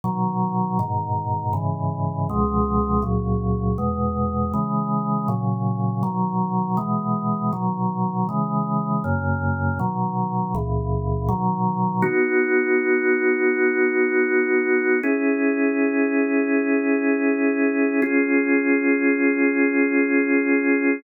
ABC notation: X:1
M:4/4
L:1/8
Q:1/4=80
K:B
V:1 name="Drawbar Organ"
[B,,D,F,]2 [G,,B,,D,]2 [G,,C,E,]2 [C,,B,,^E,G,]2 | [C,,A,,F,]2 [E,,B,,G,]2 [C,E,G,]2 [A,,C,F,]2 | [B,,D,F,]2 [B,,E,G,]2 [B,,D,F,]2 [C,E,G,]2 | [F,,C,A,]2 [B,,D,F,]2 [C,,A,,E,]2 [B,,D,F,]2 |
[B,DF]8 | [CEG]8 | [C^EG]8 |]